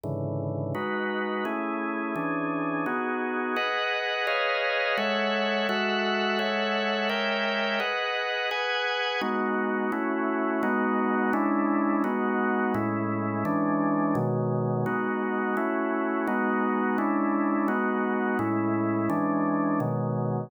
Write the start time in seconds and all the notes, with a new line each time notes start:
0.03 G#2 C#3 D3 E3
0.75 G#3 D#4 F#4 B4
1.45 A3 C#4 E4 G#4
2.15 E3 C#4 D4 G#4
2.86 B3 D#4 F#4 G#4
3.56 G#4 B4 D#5 F#5
4.27 G#4 B4 C#5 D#5 F5
4.97 G#3 A4 C#5 E5 F#5
5.69 G#3 F#4 A4 E5 F#5
6.39 G#3 A4 C#5 E5 F#5
7.09 G#3 A#4 C#5 E5 G5
7.80 G#4 B4 D#5 F#5
8.51 G#4 B4 F#5 G#5
9.21 G#3 B3 D#4 F#4
9.92 A3 C#4 E4 F#4
10.63 G#3 B3 D#4 F#4
11.33 G#3 C#4 D4 E4
12.04 G#3 B3 D#4 F#4
12.74 A2 G#3 C#4 E4
13.45 E3 G#3 C#4 D4
14.15 B2 D#3 F#3 G#3
14.86 G#3 B3 D#4 F#4
15.57 A3 C#4 E4 F#4
16.27 G#3 B3 D#4 F#4
16.98 G#3 C#4 D4 E4
17.68 G#3 B3 D#4 F#4
18.39 A2 G#3 C#4 E4
19.10 E3 G#3 C#4 D4
19.80 B2 D#3 F#3 G#3